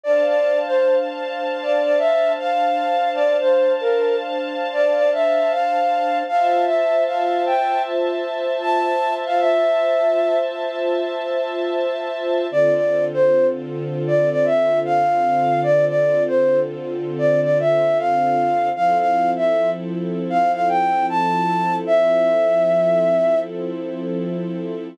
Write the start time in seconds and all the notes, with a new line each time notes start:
0.04 D4 C5 D5 F5 A5
0.26 D5
0.66 C5
1.62 D5
1.84 D5
1.98 E5
2.39 F5
3.15 D5
3.41 C5
3.81 A#4
4.73 D5
4.95 D5
5.13 E5
5.51 F5
6.28 F4 C5 E5 F5 A5
6.66 E5
7.06 F5
7.46 G5
8.62 A5
9.26 F5
9.40 E5
12.51 D3 C4 F4 A4 D5
12.74 D5
13.14 C5
14.07 D5
14.31 D5
14.45 E5
14.85 F5
15.63 D5
15.88 D5
16.27 C5
17.18 D5
17.43 D5
17.60 E5
17.99 F5
18.76 F3 C4 E4 A4 F5
18.99 F5
19.37 E5
20.30 F5
20.54 F5
20.69 G5
21.10 A5
21.87 E5